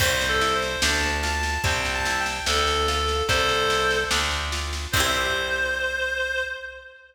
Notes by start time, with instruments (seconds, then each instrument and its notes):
0.00 electric bass (finger) C2, pizzicato strings C4, clarinet C5, kick, snare, crash
0.21 snare
0.29 clarinet A4
0.41 pizzicato strings E4, snare
0.55 clarinet C5
0.62 snare
0.82 electric bass (finger) D2, pizzicato strings D4, clarinet A5, snare
1.03 snare
1.23 pizzicato strings F4, clarinet A5, snare
1.43 snare
1.64 electric bass (finger) C2, pizzicato strings C4, clarinet G5, kick, snare
1.85 snare
1.94 clarinet A5
2.05 pizzicato strings E4, snare
2.20 clarinet G5
2.26 snare
2.46 electric bass (finger) D2, pizzicato strings D4, clarinet A4, snare
2.67 snare
2.87 pizzicato strings F4, clarinet A4, snare
3.08 snare
3.29 electric bass (finger) C2, pizzicato strings C4, clarinet A4 C5, kick, snare
3.49 snare
3.70 pizzicato strings E4, snare
3.91 snare
4.11 electric bass (finger) D2, pizzicato strings D4, snare
4.31 snare
4.52 pizzicato strings F4, snare
4.73 snare
4.92 electric bass (finger) C2, pizzicato strings C4, clarinet C5, kick, crash
4.97 pizzicato strings E4 G4